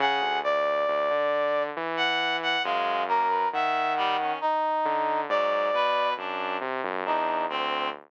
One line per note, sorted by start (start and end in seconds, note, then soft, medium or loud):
0.00 0.20 C#3 medium
0.00 0.40 G#4 medium
0.00 0.39 F#5 medium
0.22 0.41 D2 medium
0.44 0.84 D2 medium
0.44 1.63 D5 medium
0.88 1.08 D2 loud
1.10 1.70 D3 medium
1.77 2.56 E3 medium
1.97 2.37 F#5 loud
2.43 2.63 F#5 loud
2.64 3.44 F#2 loud
2.64 3.03 G#3 medium
2.64 3.05 F5 medium
3.08 3.27 A#3 medium
3.08 3.48 A#4 medium
3.28 3.48 B4 medium
3.53 4.32 D#3 medium
3.53 3.94 E5 medium
3.53 4.32 F#5 medium
3.97 4.17 G3 loud
4.19 4.39 C#4 medium
4.41 5.21 D#4 medium
4.85 5.25 D3 medium
5.29 5.69 G#2 loud
5.29 5.70 F#3 medium
5.29 6.09 D5 medium
5.73 6.13 B2 medium
5.73 6.14 B4 loud
6.17 6.57 F#2 medium
6.17 6.57 D4 medium
6.61 6.81 C3 medium
6.84 7.04 F#2 loud
7.05 7.46 E2 medium
7.05 7.44 D4 soft
7.05 7.46 D#4 medium
7.50 7.89 D2 medium
7.50 7.89 C4 medium